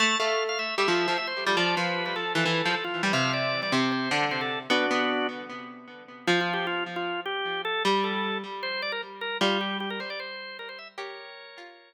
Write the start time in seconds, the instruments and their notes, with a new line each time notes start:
0.00 harpsichord A3, drawbar organ A5
0.20 harpsichord A3, drawbar organ F5
0.49 drawbar organ F5
0.59 drawbar organ E5
0.78 harpsichord G3, drawbar organ E5
0.88 harpsichord F3
1.08 harpsichord F3
1.18 drawbar organ E5
1.27 drawbar organ C5
1.46 harpsichord G3
1.57 harpsichord F3, drawbar organ D5
1.77 harpsichord F3, drawbar organ B4
2.06 drawbar organ B4
2.16 drawbar organ A4
2.35 harpsichord E3, drawbar organ A4
2.46 harpsichord E3
2.65 harpsichord F3
2.74 drawbar organ A4
2.84 drawbar organ F4
3.03 harpsichord G3
3.13 harpsichord C3, drawbar organ F5
3.33 drawbar organ D5
3.63 drawbar organ D5
3.72 harpsichord C3, drawbar organ C5
3.92 drawbar organ C5
4.11 harpsichord D3
4.31 drawbar organ C5
4.41 drawbar organ A4
4.70 harpsichord B3, drawbar organ D4 F#4
4.91 harpsichord B3
6.27 harpsichord F3, drawbar organ F4
6.41 drawbar organ F4
6.54 drawbar organ G4
6.67 drawbar organ F4
6.96 drawbar organ F4
7.26 drawbar organ G4
7.65 drawbar organ A4
7.85 harpsichord G3
8.04 drawbar organ A4
8.63 drawbar organ C5
8.82 drawbar organ D5
8.92 drawbar organ A#4
9.21 drawbar organ A#4
9.41 harpsichord G3, drawbar organ F4
9.61 drawbar organ G4
9.80 drawbar organ G4
9.90 drawbar organ A#4
10.00 drawbar organ C5
10.10 drawbar organ D5
10.20 drawbar organ C5
10.59 drawbar organ A#4
10.69 drawbar organ C5
10.79 drawbar organ E5
10.98 harpsichord G4, drawbar organ A#4 C#5
11.58 harpsichord F4